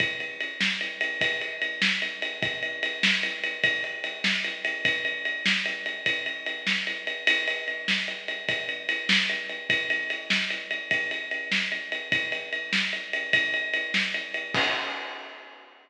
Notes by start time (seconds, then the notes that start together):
0.00 kick, ride
0.20 ride
0.40 ride
0.61 snare
0.81 ride
1.01 ride
1.21 kick, ride
1.41 ride
1.62 ride
1.82 snare
2.02 ride
2.22 ride
2.43 kick, ride
2.63 ride
2.83 ride
3.03 snare
3.23 ride
3.44 ride
3.64 kick, ride
3.84 ride
4.04 ride
4.24 snare
4.44 ride
4.65 ride
4.85 kick, ride
5.05 ride
5.25 ride
5.46 snare
5.66 ride
5.86 ride
6.06 kick, ride
6.26 ride
6.46 ride
6.67 snare
6.87 ride
7.07 ride
7.27 ride
7.48 ride
7.68 ride
7.88 snare
8.08 ride
8.28 ride
8.49 kick, ride
8.69 ride
8.89 ride
9.09 snare
9.29 ride
9.49 ride
9.70 kick, ride
9.90 ride
10.10 ride
10.30 snare
10.50 ride
10.71 ride
10.91 kick, ride
11.11 ride
11.31 ride
11.52 snare
11.72 ride
11.92 ride
12.12 kick, ride
12.32 ride
12.53 ride
12.73 snare
12.93 ride
13.13 ride
13.33 kick, ride
13.54 ride
13.74 ride
13.94 snare
14.14 ride
14.34 ride
14.54 kick, crash